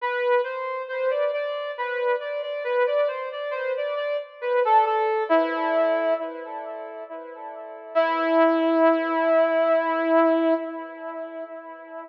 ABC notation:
X:1
M:3/4
L:1/16
Q:1/4=68
K:Em
V:1 name="Brass Section"
B2 c2 c d d2 B2 d d | B d c d c d d z B A A2 | E4 z8 | E12 |]